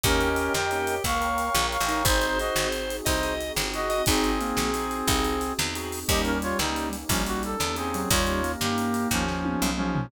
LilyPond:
<<
  \new Staff \with { instrumentName = "Brass Section" } { \time 12/8 \key ees \major \tempo 4. = 119 <des' bes'>4. <bes' g''>4. <f'' des'''>2 <f'' des'''>4 | <ees' c''>4 <ges' ees''>4 r4 <ees' c''>4 r4 <ges' ees''>4 | <c' aes'>1~ <c' aes'>8 r4. | <g' ees''>8 <des' bes'>8 <f' des''>8 <g ees'>4 r8 <f des'>8 ges'8 a'4 <c' aes'>4 |
<f' des''>4. <bes g'>4. <f des'>2 <f des'>4 | }
  \new Staff \with { instrumentName = "Drawbar Organ" } { \time 12/8 \key ees \major g'2. bes4. r4 ees'8 | c''2. ees''4. r4 ees''8 | ees'4 bes4 r4 ees'4 r2 | g2. g4. r4 ges8 |
g4 bes2~ bes8 r2 r8 | }
  \new Staff \with { instrumentName = "Drawbar Organ" } { \time 12/8 \key ees \major <bes des' ees' g'>2 <bes des' ees' g'>1 | <c' ees' ges' aes'>1. | <c' ees' ges' aes'>2 <c' ees' ges' aes'>2. <c' ees' ges' aes'>4 | <bes des' ees' g'>1~ <bes des' ees' g'>4 <bes des' ees' g'>4 |
r1. | }
  \new Staff \with { instrumentName = "Electric Bass (finger)" } { \clef bass \time 12/8 \key ees \major ees,4. f,4. des,4. bes,,8. a,,8. | aes,,4. aes,,4. c,4. g,,4. | aes,,4. bes,,4. c,4. e,4. | ees,4. des,4. bes,,4. e,4. |
ees,4. g,4. ees,4. b,,4. | }
  \new Staff \with { instrumentName = "Pad 2 (warm)" } { \time 12/8 \key ees \major <bes' des'' ees'' g''>2. <bes' des'' g'' bes''>2. | <c' ees' ges' aes'>1. | <c' ees' ges' aes'>1. | <bes des' ees' g'>1. |
<bes des' ees' g'>1. | }
  \new DrumStaff \with { instrumentName = "Drums" } \drummode { \time 12/8 <hh bd>8 hh8 hh8 sn8 hh8 hh8 <hh bd>8 hh8 hh8 sn8 hh8 hh8 | <hh bd>8 hh8 hh8 sn8 hh8 hh8 <hh bd>8 hh8 hh8 sn8 hh8 hh8 | <hh bd>8 hh8 hh8 sn8 hh8 hh8 <hh bd>8 hh8 hh8 sn8 hh8 hho8 | <hh bd>8 hh8 hh8 sn8 hh8 hh8 <hh bd>8 hh8 hh8 sn8 hh8 hh8 |
<hh bd>8 hh8 hh8 sn8 hh8 hh8 <bd sn>8 sn8 tommh8 toml8 toml8 tomfh8 | }
>>